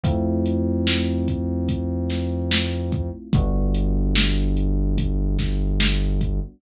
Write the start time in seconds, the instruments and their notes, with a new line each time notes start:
0.04 synth bass 1 F2, electric piano 1 A3 C4 E4 F4, kick, closed hi-hat
0.46 closed hi-hat
0.87 snare
1.28 kick, closed hi-hat
1.68 kick, closed hi-hat
2.10 snare, closed hi-hat
2.51 snare
2.92 kick, closed hi-hat
3.33 synth bass 1 G1, electric piano 1 G3 B3 D4 F#4, kick, closed hi-hat
3.74 closed hi-hat
4.16 snare
4.57 closed hi-hat
4.98 kick, closed hi-hat
5.39 kick, snare, closed hi-hat
5.80 snare
6.21 kick, closed hi-hat